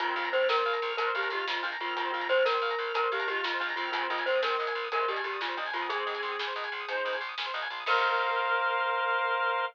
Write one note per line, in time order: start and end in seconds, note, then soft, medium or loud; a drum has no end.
0.00 0.14 A#1 loud
0.00 0.62 D#3 loud
0.00 0.62 C4 loud
0.00 0.15 F4 loud
0.00 0.07 A#4 medium
0.00 kick medium
0.00 closed hi-hat medium
0.08 0.15 C5 medium
0.16 0.30 A#1 loud
0.16 0.30 F4 loud
0.16 0.24 F5 medium
0.25 0.32 A#5 medium
0.25 closed hi-hat medium
0.32 0.47 A#1 medium
0.32 0.47 C5 loud
0.32 0.40 C6 medium
0.41 0.49 F6 medium
0.48 0.62 A#1 medium
0.48 0.56 A#4 medium
0.48 0.91 A#4 loud
0.48 snare loud
0.56 0.64 C5 medium
0.65 0.80 A#1 medium
0.65 0.73 F5 medium
0.73 0.80 A#5 medium
0.73 closed hi-hat medium
0.82 0.96 A#1 loud
0.82 0.89 C6 medium
0.90 0.97 F6 medium
0.97 1.12 A#1 medium
0.97 1.12 D4 medium
0.97 1.05 A#4 medium
0.97 1.11 A#4 medium
0.97 1.12 A#4 loud
0.97 closed hi-hat loud
1.06 1.14 C5 medium
1.15 1.29 A#1 loud
1.15 1.29 D4 medium
1.15 1.30 G4 medium
1.15 1.29 A#4 loud
1.15 1.23 F5 medium
1.23 1.31 A#5 medium
1.23 closed hi-hat medium
1.30 1.44 A#1 loud
1.30 1.71 G#3 medium
1.30 1.71 F4 medium
1.30 1.46 G4 loud
1.30 1.38 C6 medium
1.39 1.46 F6 medium
1.48 1.61 A#1 medium
1.48 1.63 F4 loud
1.48 1.55 A#4 medium
1.48 snare loud
1.57 1.64 C5 medium
1.63 1.78 A#1 loud
1.63 1.77 D4 loud
1.63 1.70 F5 medium
1.72 1.79 A#5 medium
1.72 closed hi-hat medium
1.80 1.94 A#1 medium
1.80 1.96 D#3 medium
1.80 1.96 C4 loud
1.80 1.96 F4 loud
1.80 1.89 C6 medium
1.88 1.95 F6 medium
1.96 2.11 A#1 medium
1.96 2.56 D#3 medium
1.96 2.56 C4 loud
1.96 2.12 F4 loud
1.96 2.04 A#4 medium
1.96 kick loud
1.96 closed hi-hat medium
2.05 2.12 C5 medium
2.12 2.28 A#1 medium
2.12 2.28 F4 loud
2.12 2.21 F5 medium
2.20 2.28 A#5 medium
2.20 closed hi-hat medium
2.29 2.43 A#1 medium
2.29 2.45 C5 loud
2.29 2.37 C6 medium
2.38 2.45 F6 medium
2.45 2.60 A#1 loud
2.45 2.52 A#4 medium
2.45 2.93 A#4 loud
2.45 snare loud
2.54 2.61 C5 medium
2.62 2.75 A#1 medium
2.62 2.70 F5 medium
2.70 2.78 A#5 medium
2.70 closed hi-hat medium
2.78 2.92 A#1 medium
2.78 2.86 C6 medium
2.88 2.95 F6 medium
2.94 3.08 A#1 medium
2.94 3.08 D4 medium
2.94 3.01 A#4 medium
2.94 3.08 A#4 medium
2.94 3.10 A#4 loud
2.94 closed hi-hat loud
3.03 3.10 C5 medium
3.12 3.26 A#1 loud
3.12 3.27 D4 loud
3.12 3.27 G4 medium
3.12 3.27 A#4 loud
3.12 3.20 F5 medium
3.19 3.27 A#5 medium
3.19 closed hi-hat medium
3.27 3.41 A#1 medium
3.27 3.71 G#3 loud
3.27 3.71 F4 loud
3.27 3.43 G4 loud
3.27 3.36 C6 medium
3.35 3.43 F6 medium
3.44 3.58 A#1 medium
3.44 3.60 F4 medium
3.44 3.52 A#4 medium
3.44 snare loud
3.53 3.61 C5 medium
3.60 3.75 A#1 medium
3.60 3.75 D4 medium
3.60 3.67 F5 medium
3.69 3.77 A#5 medium
3.69 closed hi-hat medium
3.76 3.91 A#1 loud
3.76 3.91 D#3 loud
3.76 3.91 C4 loud
3.76 3.89 F4 loud
3.76 3.84 C6 medium
3.85 3.92 F6 medium
3.92 4.07 A#1 loud
3.92 4.56 D#3 loud
3.92 4.56 C4 loud
3.92 4.08 F4 loud
3.92 4.02 G#4 loud
3.92 kick loud
3.92 closed hi-hat loud
4.02 4.09 C5 medium
4.10 4.24 A#1 loud
4.10 4.25 F4 loud
4.10 4.18 D#5 medium
4.18 4.25 G#5 medium
4.18 closed hi-hat medium
4.26 4.40 A#1 medium
4.26 4.41 C5 medium
4.26 4.35 C6 medium
4.35 4.43 D#6 medium
4.42 4.56 A#1 loud
4.42 4.50 G#4 medium
4.42 4.86 A#4 medium
4.42 snare loud
4.50 4.58 C5 medium
4.58 4.74 A#1 medium
4.58 4.66 D#5 medium
4.67 4.74 G#5 medium
4.67 closed hi-hat medium
4.75 4.89 A#1 medium
4.75 4.83 C6 medium
4.84 4.91 D#6 medium
4.91 5.06 A#1 medium
4.91 5.05 C3 loud
4.91 5.05 G#3 loud
4.91 5.00 G#4 medium
4.91 5.08 A#4 loud
4.91 closed hi-hat medium
5.00 5.08 C5 medium
5.08 5.22 A#1 medium
5.08 5.23 A#2 medium
5.08 5.23 G3 loud
5.08 5.22 G4 medium
5.08 5.17 D#5 medium
5.16 5.24 G#5 medium
5.16 closed hi-hat medium
5.23 5.38 A#1 medium
5.23 5.64 A#2 medium
5.23 5.64 G3 loud
5.23 5.39 G4 medium
5.23 5.32 C6 medium
5.33 5.40 D#6 medium
5.41 5.55 A#1 loud
5.41 5.57 F4 medium
5.41 5.49 G#4 medium
5.41 snare medium
5.48 5.55 C5 medium
5.57 5.71 A#1 medium
5.57 5.72 D4 loud
5.57 5.65 D#5 medium
5.66 5.73 G#5 medium
5.66 open hi-hat medium
5.73 5.87 A#1 medium
5.73 5.89 D#3 medium
5.73 5.89 C4 medium
5.73 5.88 F4 loud
5.73 5.81 C6 medium
5.82 5.89 D#6 medium
5.89 6.04 A#1 medium
5.89 6.38 C4 loud
5.89 7.18 G#4 loud
5.89 6.38 G#4 loud
5.89 5.97 G#4 medium
5.89 kick loud
5.89 closed hi-hat medium
5.98 6.05 C5 medium
6.06 6.21 A#1 medium
6.06 6.13 D#5 medium
6.14 6.22 G#5 medium
6.14 closed hi-hat medium
6.22 6.36 A#1 medium
6.22 6.30 C6 medium
6.32 6.39 D#6 medium
6.39 6.53 A#1 medium
6.39 6.48 G#4 medium
6.39 snare loud
6.47 6.55 C5 medium
6.56 6.70 A#1 loud
6.56 6.63 D#5 medium
6.64 6.72 G#5 medium
6.64 closed hi-hat medium
6.72 6.86 A#1 medium
6.72 6.81 C6 medium
6.80 6.88 D#6 medium
6.87 7.02 A#1 medium
6.87 7.15 D#4 medium
6.87 6.96 G#4 medium
6.87 7.15 C5 loud
6.87 closed hi-hat medium
6.97 7.05 C5 medium
7.05 7.19 A#1 medium
7.05 7.12 D#5 medium
7.13 7.22 G#5 medium
7.13 closed hi-hat medium
7.20 7.35 A#1 loud
7.20 7.28 C6 medium
7.29 7.36 D#6 medium
7.38 7.52 A#1 medium
7.38 7.46 G#4 medium
7.38 snare loud
7.46 7.53 C5 medium
7.54 7.68 A#1 loud
7.54 7.61 D#5 medium
7.62 7.69 G#5 medium
7.62 closed hi-hat medium
7.70 7.84 A#1 loud
7.70 7.79 C6 medium
7.80 7.87 D#6 medium
7.86 9.63 A#1 loud
7.86 9.63 A#4 loud
7.86 9.64 A#4 loud
7.86 9.65 A#4 loud
7.86 9.65 C5 loud
7.86 9.65 F5 medium
7.86 kick loud
7.86 crash loud